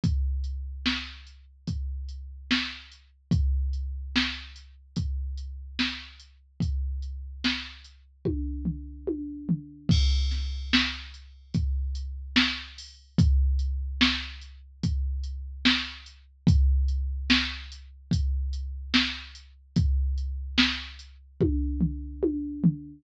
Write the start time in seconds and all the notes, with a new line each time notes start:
0.04 kick, closed hi-hat
0.44 closed hi-hat
0.86 snare
1.27 closed hi-hat
1.67 kick, closed hi-hat
2.09 closed hi-hat
2.51 snare
2.91 closed hi-hat
3.31 kick, closed hi-hat
3.73 closed hi-hat
4.16 snare
4.56 closed hi-hat
4.96 kick, closed hi-hat
5.38 closed hi-hat
5.79 snare
6.20 closed hi-hat
6.60 kick, closed hi-hat
7.02 closed hi-hat
7.44 snare
7.84 closed hi-hat
8.25 kick, high tom
8.65 floor tom
9.07 high tom
9.49 floor tom
9.89 kick, crash
10.31 snare, closed hi-hat
10.73 snare
11.14 closed hi-hat
11.54 kick, closed hi-hat
11.95 closed hi-hat
12.36 snare
12.78 open hi-hat
13.18 kick, closed hi-hat
13.59 closed hi-hat
14.01 snare
14.41 closed hi-hat
14.83 kick, closed hi-hat
15.23 closed hi-hat
15.65 snare
16.06 closed hi-hat
16.47 kick, closed hi-hat
16.88 closed hi-hat
17.30 snare
17.72 closed hi-hat
18.11 kick, closed hi-hat
18.53 closed hi-hat
18.94 snare
19.35 closed hi-hat
19.76 kick, closed hi-hat
20.18 closed hi-hat
20.58 snare
20.99 closed hi-hat
21.40 kick, high tom
21.80 floor tom
22.23 high tom
22.64 floor tom